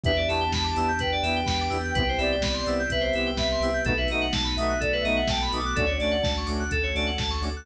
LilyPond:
<<
  \new Staff \with { instrumentName = "Ocarina" } { \time 4/4 \key e \minor \tempo 4 = 126 e''8 a''8 a''16 a''8 r16 g''16 g''8. g''16 g''8. | g''8 d''8 d''16 d''8 r16 e''16 e''8. e''16 e''8. | b'16 e''8 r8. e''8 d''16 e''8. g''16 b''16 d'''8 | d''4 r2. | }
  \new Staff \with { instrumentName = "Lead 2 (sawtooth)" } { \time 4/4 \key e \minor <b d' e' g'>8 <b d' e' g'>4 <b d' e' g'>4 <b d' e' g'>4 <b d' e' g'>8 | <b c' e' g'>8 <b c' e' g'>4 <b c' e' g'>4 <b c' e' g'>4 <b c' e' g'>8 | <a b dis' fis'>8 <a b dis' fis'>4 <a b dis' fis'>4 <a b dis' fis'>4 <a b dis' fis'>8 | <a cis' d' fis'>8 <a cis' d' fis'>4 <a cis' d' fis'>4 <a cis' d' fis'>4 <a cis' d' fis'>8 | }
  \new Staff \with { instrumentName = "Electric Piano 2" } { \time 4/4 \key e \minor b'16 d''16 e''16 g''16 b''16 d'''16 e'''16 g'''16 b'16 d''16 e''16 g''16 b''16 d'''16 e'''16 g'''16 | b'16 c''16 e''16 g''16 b''16 c'''16 e'''16 g'''16 b'16 c''16 e''16 g''16 b''16 c'''16 e'''16 g'''16 | a'16 b'16 dis''16 fis''16 a''16 b''16 dis'''16 fis'''16 a'16 b'16 dis''16 fis''16 a''16 b''16 dis'''16 fis'''16 | a'16 cis''16 d''16 fis''16 a''16 cis'''16 d'''16 fis'''16 a'16 cis''16 d''16 fis''16 a''16 cis'''16 d'''16 fis'''16 | }
  \new Staff \with { instrumentName = "Synth Bass 2" } { \clef bass \time 4/4 \key e \minor e,8 e,8 e,8 e,8 e,8 e,8 e,8 e,8 | c,8 c,8 c,8 c,8 c,8 c,8 c,8 c,8 | b,,8 b,,8 b,,8 b,,8 b,,8 b,,8 b,,8 b,,8 | d,8 d,8 d,8 d,8 d,8 d,8 d,8 d,8 | }
  \new Staff \with { instrumentName = "Pad 5 (bowed)" } { \time 4/4 \key e \minor <b d' e' g'>2 <b d' g' b'>2 | <b c' e' g'>2 <b c' g' b'>2 | <a b dis' fis'>2 <a b fis' a'>2 | <a cis' d' fis'>2 <a cis' fis' a'>2 | }
  \new DrumStaff \with { instrumentName = "Drums" } \drummode { \time 4/4 <hh bd>8 hho8 <bd sn>8 hho8 <hh bd>8 hho8 <bd sn>8 hho8 | <hh bd>8 hho8 <bd sn>8 hho8 <hh bd>8 hho8 <bd sn>8 hho8 | <hh bd>8 hho8 <bd sn>8 hho8 <hh bd>8 hho8 <bd sn>8 hho8 | <hh bd>8 hho8 <bd sn>8 hho8 <hh bd>8 hho8 <bd sn>8 hho8 | }
>>